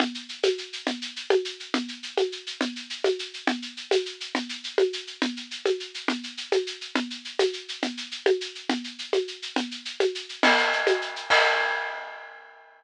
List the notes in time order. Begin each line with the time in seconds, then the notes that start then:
0.00 low conga, shaker
0.14 shaker
0.29 shaker
0.43 high conga, shaker
0.58 shaker
0.73 shaker
0.87 low conga, shaker
1.02 shaker
1.16 shaker
1.30 high conga, shaker
1.45 shaker
1.60 shaker
1.74 low conga, shaker
1.88 shaker
2.03 shaker
2.17 high conga, shaker
2.32 shaker
2.47 shaker
2.61 low conga, shaker
2.76 shaker
2.90 shaker
3.04 high conga, shaker
3.19 shaker
3.34 shaker
3.47 low conga, shaker
3.62 shaker
3.77 shaker
3.91 high conga, shaker
4.06 shaker
4.20 shaker
4.35 low conga, shaker
4.49 shaker
4.64 shaker
4.78 high conga, shaker
4.93 shaker
5.07 shaker
5.22 low conga, shaker
5.37 shaker
5.51 shaker
5.66 high conga, shaker
5.80 shaker
5.94 shaker
6.08 low conga, shaker
6.23 shaker
6.37 shaker
6.52 high conga, shaker
6.67 shaker
6.81 shaker
6.95 low conga, shaker
7.10 shaker
7.25 shaker
7.39 high conga, shaker
7.53 shaker
7.68 shaker
7.82 low conga, shaker
7.97 shaker
8.11 shaker
8.26 high conga, shaker
8.41 shaker
8.55 shaker
8.69 low conga, shaker
8.84 shaker
8.99 shaker
9.13 high conga, shaker
9.28 shaker
9.42 shaker
9.56 low conga, shaker
9.71 shaker
9.85 shaker
10.00 high conga, shaker
10.15 shaker
10.29 shaker
10.43 crash, low conga, shaker
10.58 shaker
10.72 shaker
10.87 high conga, shaker
11.01 shaker
11.16 shaker
11.30 kick, crash